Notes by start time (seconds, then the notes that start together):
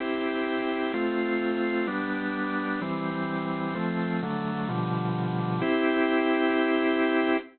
0.00 C4 E4 G4
0.94 A3 C4 F4
1.87 G3 B3 D4
2.82 E3 G3 C4
3.75 F3 A3 C4
4.22 D3 F#3 A3
4.69 B2 D3 F3 G3
5.61 C4 E4 G4